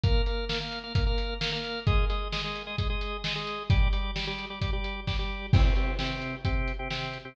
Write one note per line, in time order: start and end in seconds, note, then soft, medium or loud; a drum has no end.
0.04 0.22 A#3 loud
0.04 0.22 A#4 loud
0.04 0.22 F5 loud
0.04 kick medium
0.04 closed hi-hat medium
0.26 0.45 A#3 medium
0.26 0.45 A#4 medium
0.26 0.45 F5 medium
0.26 closed hi-hat medium
0.49 0.58 A#3 medium
0.49 0.58 A#4 medium
0.49 0.58 F5 medium
0.49 snare medium
0.61 0.79 A#3 medium
0.61 0.79 A#4 medium
0.61 0.79 F5 loud
0.72 closed hi-hat medium
0.84 0.93 A#3 medium
0.84 0.93 A#4 medium
0.84 0.93 F5 medium
0.95 1.04 A#3 medium
0.95 1.04 A#4 medium
0.95 1.04 F5 medium
0.95 kick medium
0.95 closed hi-hat loud
1.07 1.34 A#3 medium
1.07 1.34 A#4 loud
1.07 1.34 F5 medium
1.18 closed hi-hat medium
1.41 1.50 A#3 medium
1.41 1.50 A#4 loud
1.41 1.50 F5 medium
1.41 snare loud
1.52 1.80 A#3 loud
1.52 1.80 A#4 medium
1.52 1.80 F5 loud
1.64 closed hi-hat medium
1.87 2.05 G#3 loud
1.87 2.05 G#4 loud
1.87 2.05 D#5 loud
1.87 kick medium
1.87 closed hi-hat medium
2.10 2.28 G#3 medium
2.10 2.28 G#4 medium
2.10 2.28 D#5 medium
2.10 closed hi-hat medium
2.32 2.42 G#3 loud
2.32 2.42 G#4 medium
2.32 2.42 D#5 medium
2.32 snare medium
2.44 2.62 G#3 medium
2.44 2.62 G#4 medium
2.44 2.62 D#5 medium
2.56 closed hi-hat medium
2.67 2.76 G#3 loud
2.67 2.76 G#4 loud
2.67 2.76 D#5 loud
2.78 2.87 G#3 medium
2.78 2.87 G#4 medium
2.78 2.87 D#5 medium
2.78 kick medium
2.78 closed hi-hat medium
2.90 3.17 G#3 medium
2.90 3.17 G#4 medium
2.90 3.17 D#5 medium
3.01 closed hi-hat medium
3.24 3.33 G#3 medium
3.24 3.33 G#4 medium
3.24 3.33 D#5 medium
3.24 snare loud
3.35 3.63 G#3 medium
3.35 3.63 G#4 medium
3.35 3.63 D#5 medium
3.47 closed hi-hat medium
3.70 3.88 G3 loud
3.70 3.88 G4 loud
3.70 3.88 D5 loud
3.70 kick loud
3.70 closed hi-hat medium
3.93 4.11 G3 medium
3.93 4.11 G4 medium
3.93 4.11 D5 loud
3.93 closed hi-hat medium
4.16 4.25 G3 medium
4.16 4.25 G4 medium
4.16 4.25 D5 medium
4.16 snare medium
4.27 4.46 G3 loud
4.27 4.46 G4 medium
4.27 4.46 D5 loud
4.39 closed hi-hat medium
4.50 4.59 G3 medium
4.50 4.59 G4 medium
4.50 4.59 D5 medium
4.61 4.71 G3 loud
4.61 4.71 G4 medium
4.61 4.71 D5 medium
4.61 kick medium
4.61 closed hi-hat medium
4.73 5.00 G3 medium
4.73 5.00 G4 medium
4.73 5.00 D5 medium
4.84 closed hi-hat medium
5.07 5.17 G3 medium
5.07 5.17 G4 medium
5.07 5.17 D5 medium
5.07 kick medium
5.07 snare medium
5.19 5.46 G3 medium
5.19 5.46 G4 medium
5.19 5.46 D5 medium
5.53 5.62 C3 loud
5.53 5.62 C4 loud
5.53 5.62 G4 loud
5.53 kick loud
5.53 crash loud
5.65 5.74 C3 medium
5.65 5.74 C4 medium
5.65 5.74 G4 medium
5.76 5.94 C3 medium
5.76 5.94 C4 medium
5.76 5.94 G4 medium
5.76 closed hi-hat medium
5.99 6.35 C3 loud
5.99 6.35 C4 medium
5.99 6.35 G4 medium
5.99 snare medium
6.22 closed hi-hat medium
6.45 6.72 C3 medium
6.45 6.72 C4 medium
6.45 6.72 G4 loud
6.45 kick medium
6.45 closed hi-hat medium
6.68 closed hi-hat medium
6.79 6.88 C3 medium
6.79 6.88 C4 medium
6.79 6.88 G4 medium
6.90 7.18 C3 medium
6.90 7.18 C4 loud
6.90 7.18 G4 medium
6.90 snare medium
7.13 closed hi-hat medium
7.25 7.34 C3 medium
7.25 7.34 C4 loud
7.25 7.34 G4 medium